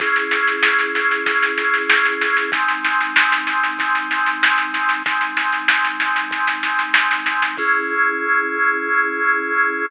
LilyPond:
<<
  \new Staff \with { instrumentName = "Drawbar Organ" } { \time 4/4 \key cis \minor \tempo 4 = 95 <cis' e' gis'>1 | <gis bis dis'>1 | <gis bis dis'>1 | <cis' e' gis'>1 | }
  \new DrumStaff \with { instrumentName = "Drums" } \drummode { \time 4/4 <bd sn>16 sn16 sn16 sn16 sn16 sn16 sn16 sn16 <bd sn>16 sn16 sn16 sn16 sn16 sn16 sn16 sn16 | <bd sn>16 sn16 sn16 sn16 sn16 sn16 sn16 sn16 <bd sn>16 sn16 sn16 sn16 sn16 sn16 sn16 sn16 | <bd sn>16 sn16 sn16 sn16 sn16 sn16 sn16 sn16 <bd sn>16 sn16 sn16 sn16 sn16 sn16 sn16 sn16 | <cymc bd>4 r4 r4 r4 | }
>>